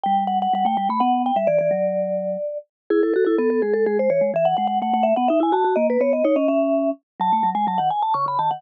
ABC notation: X:1
M:3/4
L:1/16
Q:1/4=126
K:D
V:1 name="Vibraphone"
g2 f f f g g b f2 g e | d d9 z2 | [K:E] G A A A A A G A G ^B c2 | e f f f f f e f e g a2 |
d B c d c d e4 z2 | a3 g a f g a c' b a f |]
V:2 name="Vibraphone"
G,4 G, A, G, A, B,3 G, | E, E, F,6 z4 | [K:E] E2 F E B,2 G,2 G,2 E, G, | E,2 G,2 A, A,2 B, D E F F |
^A,2 B,2 D C C4 z2 | F, A, F, G, F, D, z2 C, C, D, D, |]